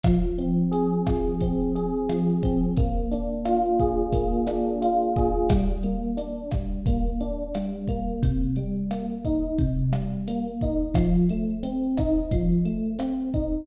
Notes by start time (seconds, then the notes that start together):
0.03 F3, kick, cross-stick, closed hi-hat
0.38 C4, closed hi-hat
0.71 G#4, closed hi-hat
1.06 F3, kick, cross-stick, closed hi-hat
1.40 C4, kick, closed hi-hat
1.75 G#4, closed hi-hat
2.09 F3, cross-stick, closed hi-hat
2.43 C4, kick, closed hi-hat
2.77 A#3, kick, closed hi-hat
3.11 D4, closed hi-hat
3.45 F4, cross-stick, closed hi-hat
3.80 G#4, kick, closed hi-hat
4.12 A#3, kick, closed hi-hat
4.47 D4, cross-stick, closed hi-hat
4.82 F4, closed hi-hat
5.16 G#4, kick, closed hi-hat
5.49 G3, kick, cross-stick, closed hi-hat
5.83 A#3, closed hi-hat
6.17 D4, closed hi-hat
6.51 G3, kick, cross-stick, closed hi-hat
6.86 A#3, kick, closed hi-hat
7.20 D4, closed hi-hat
7.54 G3, cross-stick, closed hi-hat
7.87 A#3, kick, closed hi-hat
8.22 C3, kick, closed hi-hat
8.56 G3, closed hi-hat
8.91 A#3, cross-stick, closed hi-hat
9.25 D#4, kick, closed hi-hat
9.58 C3, kick, closed hi-hat
9.92 G3, cross-stick, closed hi-hat
10.28 A#3, closed hi-hat
10.61 D#4, kick, closed hi-hat
10.94 F3, kick, cross-stick, closed hi-hat
11.29 A3, closed hi-hat
11.63 C4, closed hi-hat
11.97 D#4, kick, cross-stick, closed hi-hat
12.31 F3, kick, closed hi-hat
12.65 A3, closed hi-hat
12.99 C4, cross-stick, closed hi-hat
13.34 D#4, kick, closed hi-hat